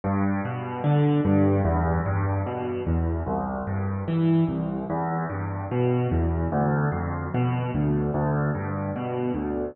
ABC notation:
X:1
M:4/4
L:1/8
Q:1/4=74
K:C
V:1 name="Acoustic Grand Piano" clef=bass
G,, B,, D, G,, E,, G,, B,, E,, | C,, G,, E, C,, E,, G,, B,, E,, | D,, F,, B,, D,, D,, G,, B,, D,, |]